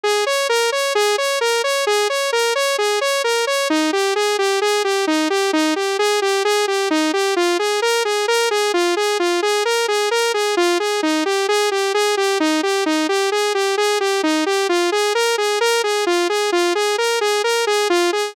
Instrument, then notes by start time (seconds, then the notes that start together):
lead 2 (sawtooth)
0.04 G#4
0.26 C#5
0.49 A#4
0.72 C#5
0.95 G#4
1.18 C#5
1.41 A#4
1.64 C#5
1.87 G#4
2.10 C#5
2.33 A#4
2.55 C#5
2.78 G#4
3.01 C#5
3.24 A#4
3.47 C#5
3.70 D#4
3.93 G4
4.16 G#4
4.39 G4
4.62 G#4
4.84 G4
5.07 D#4
5.30 G4
5.53 D#4
5.76 G4
5.99 G#4
6.22 G4
6.45 G#4
6.68 G4
6.91 D#4
7.13 G4
7.36 F4
7.59 G#4
7.82 A#4
8.05 G#4
8.28 A#4
8.51 G#4
8.74 F4
8.97 G#4
9.20 F4
9.42 G#4
9.65 A#4
9.88 G#4
10.11 A#4
10.34 G#4
10.57 F4
10.80 G#4
11.03 D#4
11.26 G4
11.49 G#4
11.71 G4
11.94 G#4
12.17 G4
12.40 D#4
12.63 G4
12.86 D#4
13.09 G4
13.32 G#4
13.55 G4
13.77 G#4
14.00 G4
14.23 D#4
14.46 G4
14.69 F4
14.92 G#4
15.15 A#4
15.38 G#4
15.61 A#4
15.84 G#4
16.07 F4
16.29 G#4
16.52 F4
16.75 G#4
16.98 A#4
17.21 G#4
17.44 A#4
17.67 G#4
17.90 F4
18.13 G#4